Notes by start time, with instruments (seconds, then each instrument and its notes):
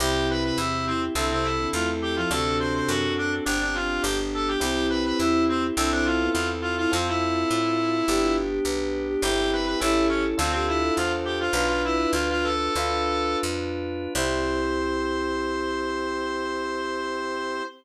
0.00 electric bass (finger) C2, violin C3, electric piano 1 C4 E4 G4, drawbar organ C4 E4 G4, clarinet G4
0.30 clarinet B4
0.43 clarinet B4
0.57 electric bass (finger) E2, clarinet E4
0.87 clarinet C4
1.15 electric bass (finger) C2, violin D3, clarinet C4, electric piano 1 C4 E4 A4, drawbar organ C4 E4 A4
1.30 violin C3, clarinet C4
1.43 clarinet E4
1.60 violin D3
1.73 electric bass (finger) E2, violin A3, clarinet F4
2.02 clarinet G4
2.16 violin F3, clarinet F4
2.30 electric bass (finger) D2, violin C3, drawbar organ C4 D4 F#4 A4, electric piano 1 C4 D4 F#4 A4, clarinet A4
2.60 clarinet C5
2.75 clarinet C5
2.88 electric bass (finger) F#2, clarinet F#4
3.18 clarinet D4
3.45 electric bass (finger) G1, electric piano 1 C4 D4 G4, drawbar organ C4 D4 G4, clarinet D4
3.61 clarinet D4
3.74 clarinet F4
4.02 electric bass (finger) G1, drawbar organ B3 D4 G4, electric piano 1 B3 D4 G4, clarinet G4
4.34 clarinet A4
4.48 clarinet G4
4.60 electric bass (finger) C2, electric piano 1 C4 E4 G4, violin C4, drawbar organ C4 E4 G4, clarinet G4
4.90 clarinet B4
5.06 clarinet B4
5.19 electric bass (finger) E2, clarinet E4
5.49 clarinet C4
5.76 electric bass (finger) C2, clarinet C4, electric piano 1 C4 E4 A4, drawbar organ C4 E4 A4, violin D4
5.92 violin C4, clarinet D4
6.05 clarinet F4
6.20 violin B3
6.34 electric bass (finger) E2, violin E4, clarinet F4
6.62 clarinet F4
6.78 violin E4, clarinet F4
6.92 electric bass (finger) F2, electric piano 1 C4 F4 A4, drawbar organ C4 F4 A4, clarinet C4, violin F4
7.08 clarinet E4
7.51 electric bass (finger) A2
8.07 electric bass (finger) G1, electric piano 1 B3 D4 G4, drawbar organ B3 D4 G4, violin G4
8.22 violin F4
8.51 violin G4
8.64 electric bass (finger) B1, violin B4
9.08 violin G4
9.22 electric bass (finger) G1, electric piano 1 C4 E4 G4, drawbar organ C4 E4 G4, clarinet G4, violin G4
9.53 clarinet B4
9.66 clarinet B4
9.80 electric bass (finger) A1, electric piano 1 C#4 E4 A4, drawbar organ C#4 E4 A4, clarinet E4
10.09 clarinet C#4
10.38 electric bass (finger) D2, clarinet C4, electric piano 1 D4 F4 A4, drawbar organ D4 F4 A4, violin A4
10.52 clarinet C4, violin G4
10.68 clarinet E4
10.82 violin A4
10.96 electric bass (finger) E2, clarinet F4, violin C5
11.25 clarinet G4
11.40 clarinet F4, violin C5
11.53 electric bass (finger) B1, electric piano 1 D4 F4 B4, drawbar organ D4 F4 B4, clarinet F4, violin B4
11.68 clarinet F4
11.85 clarinet E4
12.13 electric bass (finger) D2, clarinet F4
12.30 clarinet F4
12.43 clarinet A4
12.75 electric bass (finger) D2, electric piano 1 D4 F4 B4, drawbar organ D4 F4 B4
13.43 electric bass (finger) F2
14.15 electric bass (finger) C2, electric piano 1 C4 E4 G4, drawbar organ C4 E4 G4, clarinet C5, violin C5